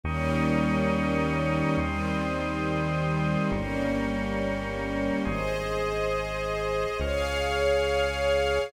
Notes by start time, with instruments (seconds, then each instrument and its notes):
0.04 synth bass 1 D#2, string ensemble 1 D#3 G3 A#3 C#4, drawbar organ G5 A#5 C#6 D#6
1.77 synth bass 1 D#2, string ensemble 1 D#3 G3 C4, drawbar organ G5 C6 D#6
3.52 synth bass 1 G1, string ensemble 1 G3 A#3 C#4, drawbar organ G5 A#5 C#6
5.25 synth bass 1 G#1, string ensemble 1 G#4 C5 D#5, drawbar organ G#5 C6 D#6
6.99 synth bass 1 C#2, string ensemble 1 G#4 C#5 F5, drawbar organ G#5 C#6 F6